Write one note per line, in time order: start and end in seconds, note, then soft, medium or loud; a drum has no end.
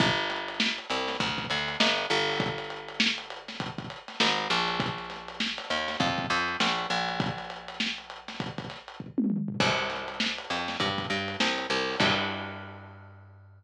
0.00 0.80 G1 loud
0.00 kick loud
0.00 closed hi-hat medium
0.18 closed hi-hat medium
0.30 snare soft
0.30 closed hi-hat medium
0.48 closed hi-hat medium
0.60 snare loud
0.78 closed hi-hat medium
0.90 1.17 C2 loud
0.90 closed hi-hat medium
1.08 snare medium
1.08 closed hi-hat medium
1.20 1.47 D2 medium
1.20 kick medium
1.20 closed hi-hat loud
1.38 kick medium
1.38 closed hi-hat medium
1.50 1.77 D2 loud
1.50 snare soft
1.50 closed hi-hat medium
1.68 closed hi-hat medium
1.80 2.06 G1 loud
1.80 snare loud
1.98 closed hi-hat medium
2.10 4.12 G1 loud
2.10 closed hi-hat medium
2.29 open hi-hat medium
2.40 kick loud
2.40 closed hi-hat loud
2.58 closed hi-hat medium
2.70 closed hi-hat medium
2.89 closed hi-hat medium
3.00 snare loud
3.18 closed hi-hat medium
3.30 closed hi-hat medium
3.48 snare medium
3.48 closed hi-hat medium
3.60 kick medium
3.60 closed hi-hat loud
3.78 kick medium
3.78 closed hi-hat medium
3.90 closed hi-hat medium
4.08 snare soft
4.08 closed hi-hat medium
4.20 4.48 G#1 loud
4.20 snare loud
4.38 closed hi-hat medium
4.50 5.59 A#1 loud
4.50 closed hi-hat medium
4.68 closed hi-hat medium
4.80 kick loud
4.80 closed hi-hat loud
4.98 closed hi-hat medium
5.10 snare soft
5.10 closed hi-hat medium
5.28 closed hi-hat medium
5.40 snare loud
5.58 snare soft
5.58 closed hi-hat medium
5.70 5.97 D#2 medium
5.70 closed hi-hat medium
5.88 snare medium
5.88 closed hi-hat medium
6.00 6.27 F2 loud
6.00 kick loud
6.00 closed hi-hat loud
6.18 kick medium
6.18 closed hi-hat medium
6.30 6.57 F2 loud
6.30 closed hi-hat medium
6.48 closed hi-hat medium
6.60 6.87 A#1 medium
6.60 snare loud
6.78 closed hi-hat medium
6.90 9.22 A#1 loud
6.90 closed hi-hat medium
7.09 closed hi-hat medium
7.20 kick loud
7.20 closed hi-hat loud
7.38 closed hi-hat medium
7.50 closed hi-hat medium
7.68 closed hi-hat medium
7.80 snare loud
7.98 closed hi-hat medium
8.10 closed hi-hat medium
8.28 snare medium
8.28 closed hi-hat medium
8.40 kick medium
8.40 closed hi-hat loud
8.58 kick medium
8.58 closed hi-hat medium
8.70 snare soft
8.70 closed hi-hat medium
8.88 closed hi-hat medium
9.00 kick medium
9.18 high tom medium
9.30 mid tom medium
9.48 floor tom loud
9.60 10.39 C2 loud
9.60 kick loud
9.60 crash loud
9.78 closed hi-hat medium
9.90 snare soft
9.90 closed hi-hat medium
10.08 closed hi-hat medium
10.20 snare loud
10.38 closed hi-hat medium
10.50 10.77 F2 medium
10.50 closed hi-hat medium
10.68 snare medium
10.68 closed hi-hat medium
10.80 11.07 G2 loud
10.80 kick medium
10.80 closed hi-hat loud
10.98 kick medium
10.98 closed hi-hat medium
11.10 11.37 G2 loud
11.10 closed hi-hat medium
11.28 closed hi-hat medium
11.40 11.67 C2 loud
11.40 snare loud
11.58 closed hi-hat medium
11.70 11.96 C2 loud
11.70 snare soft
11.70 closed hi-hat medium
11.88 open hi-hat medium
12.00 13.64 G2 loud
12.00 kick loud
12.00 crash loud